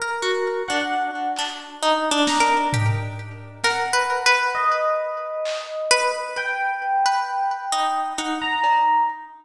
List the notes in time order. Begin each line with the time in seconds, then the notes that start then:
0.00 A#4
0.22 F#4
0.68 D4 F#5
1.36 D4, clap
1.83 D#4
2.11 D4
2.27 A#5, snare
2.40 A#4
2.73 G4, floor tom
3.64 A#4 F#5, snare
3.93 B4
4.26 B4
4.55 D#5
5.45 clap
5.91 B4
6.37 G5
7.06 B4
7.72 D#4
8.18 D#4 F#5
8.41 A#5
8.64 cowbell